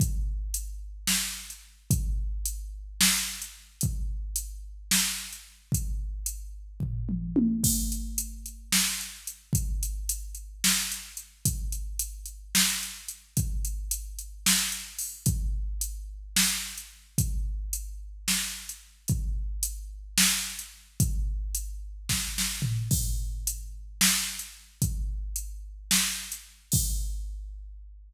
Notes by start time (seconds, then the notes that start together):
0.00 kick, closed hi-hat
0.54 closed hi-hat
1.07 snare
1.50 closed hi-hat
1.91 kick, closed hi-hat
2.45 closed hi-hat
3.01 snare
3.42 closed hi-hat
3.81 kick, closed hi-hat
4.36 closed hi-hat
4.91 snare
5.33 closed hi-hat
5.72 kick, closed hi-hat
6.26 closed hi-hat
6.80 kick, floor tom
7.09 mid tom
7.36 high tom
7.64 kick, crash
7.92 closed hi-hat
8.18 closed hi-hat
8.46 closed hi-hat
8.72 snare
9.01 closed hi-hat
9.27 closed hi-hat
9.53 kick, closed hi-hat
9.83 closed hi-hat
10.09 closed hi-hat
10.35 closed hi-hat
10.64 snare
10.92 closed hi-hat
11.17 closed hi-hat
11.45 kick, closed hi-hat
11.72 closed hi-hat
11.99 closed hi-hat
12.26 closed hi-hat
12.55 snare
12.83 closed hi-hat
13.08 closed hi-hat
13.37 kick, closed hi-hat
13.65 closed hi-hat
13.91 closed hi-hat
14.19 closed hi-hat
14.46 snare
14.72 closed hi-hat
14.99 open hi-hat
15.26 kick, closed hi-hat
15.81 closed hi-hat
16.36 snare
16.78 closed hi-hat
17.18 kick, closed hi-hat
17.73 closed hi-hat
18.28 snare
18.69 closed hi-hat
19.08 kick, closed hi-hat
19.63 closed hi-hat
20.18 snare
20.59 closed hi-hat
21.00 kick, closed hi-hat
21.55 closed hi-hat
22.09 kick, snare
22.38 snare
22.62 floor tom
22.91 kick, crash
23.47 closed hi-hat
24.01 snare
24.39 closed hi-hat
24.82 kick, closed hi-hat
25.36 closed hi-hat
25.91 snare
26.32 closed hi-hat
26.72 kick, crash